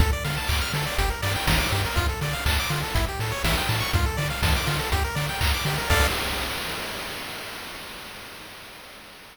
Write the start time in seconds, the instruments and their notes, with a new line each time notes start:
0.00 synth bass 1 D2, lead 1 (square) A4, kick, closed hi-hat
0.13 lead 1 (square) D5
0.24 synth bass 1 D3, lead 1 (square) F5, open hi-hat
0.37 lead 1 (square) A5
0.48 synth bass 1 D2, lead 1 (square) D6, kick, clap
0.61 lead 1 (square) F6
0.74 synth bass 1 D3, lead 1 (square) A4, open hi-hat
0.87 lead 1 (square) D5
0.98 synth bass 1 G1, lead 1 (square) G4, kick, closed hi-hat
1.10 lead 1 (square) A#4
1.22 synth bass 1 G2, lead 1 (square) D5, open hi-hat
1.35 lead 1 (square) G5
1.47 synth bass 1 G1, lead 1 (square) A#5, kick, snare
1.60 lead 1 (square) D6
1.72 synth bass 1 G2, lead 1 (square) G4, open hi-hat
1.85 lead 1 (square) A#4
1.96 synth bass 1 D2, lead 1 (square) F4, kick, closed hi-hat
2.09 lead 1 (square) A4
2.21 synth bass 1 D3, lead 1 (square) D5, open hi-hat
2.33 lead 1 (square) F5
2.46 synth bass 1 D2, lead 1 (square) A5, kick, clap
2.60 lead 1 (square) D6
2.70 synth bass 1 D3, lead 1 (square) F4, open hi-hat
2.83 lead 1 (square) A4
2.94 synth bass 1 A1, lead 1 (square) E4, kick, closed hi-hat
3.09 lead 1 (square) G4
3.19 synth bass 1 A2, lead 1 (square) A4, open hi-hat
3.32 lead 1 (square) C#5
3.44 synth bass 1 A1, lead 1 (square) E5, kick, snare
3.58 lead 1 (square) G5
3.69 synth bass 1 A2, lead 1 (square) A5, open hi-hat
3.80 lead 1 (square) C#6
3.93 synth bass 1 D2, lead 1 (square) F4, kick, closed hi-hat
4.06 lead 1 (square) A4
4.17 synth bass 1 D3, lead 1 (square) D5, open hi-hat
4.30 lead 1 (square) F5
4.43 synth bass 1 D2, lead 1 (square) A5, kick, snare
4.56 lead 1 (square) D6
4.66 synth bass 1 D3, lead 1 (square) F4, open hi-hat
4.79 lead 1 (square) A4
4.92 synth bass 1 D2, lead 1 (square) G4, kick, closed hi-hat
5.04 lead 1 (square) A#4
5.15 synth bass 1 D3, lead 1 (square) D5, open hi-hat
5.29 lead 1 (square) G5
5.41 synth bass 1 D2, lead 1 (square) A#5, kick, clap
5.54 lead 1 (square) D6
5.65 synth bass 1 D3, lead 1 (square) G4, open hi-hat
5.78 lead 1 (square) A#4
5.90 synth bass 1 D2, lead 1 (square) A4 D5 F5, kick, crash